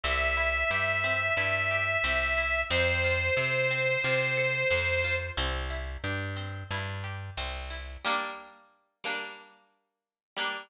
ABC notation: X:1
M:4/4
L:1/8
Q:1/4=90
K:Gdor
V:1 name="Accordion"
e8 | c8 | z8 | z8 |]
V:2 name="Pizzicato Strings"
C E G C E G C E | C F A C F A C F | C E G C E G C E | [G,B,D]3 [G,B,D]4 [G,B,D] |]
V:3 name="Electric Bass (finger)" clef=bass
C,,2 G,,2 G,,2 C,,2 | F,,2 C,2 C,2 F,,2 | C,,2 G,,2 G,,2 C,,2 | z8 |]